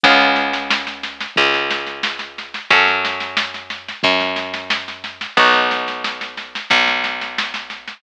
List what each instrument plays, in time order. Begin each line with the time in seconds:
0.03 electric bass (finger) C#2, acoustic guitar (steel) B3 C#4 F4 G#4, kick, snare
0.20 snare
0.36 snare
0.53 snare
0.70 snare
0.87 snare
1.03 snare
1.21 snare
1.36 electric bass (finger) C#2, kick, snare
1.54 snare
1.71 snare
1.87 snare
2.03 snare
2.19 snare
2.38 snare
2.54 snare
2.70 electric bass (finger) F#2, acoustic guitar (steel) C#4 F#4 A4, kick, snare
2.88 snare
3.05 snare
3.20 snare
3.37 snare
3.54 snare
3.70 snare
3.88 snare
4.03 electric bass (finger) F#2, kick, snare
4.20 snare
4.36 snare
4.54 snare
4.70 snare
4.88 snare
5.04 snare
5.21 snare
5.37 electric bass (finger) B1, acoustic guitar (steel) B3 D#4 F#4, kick, snare
5.54 snare
5.71 snare
5.88 snare
6.04 snare
6.21 snare
6.37 snare
6.55 snare
6.70 electric bass (finger) B1, kick, snare
6.88 snare
7.04 snare
7.21 snare
7.38 snare
7.54 snare
7.70 snare
7.88 snare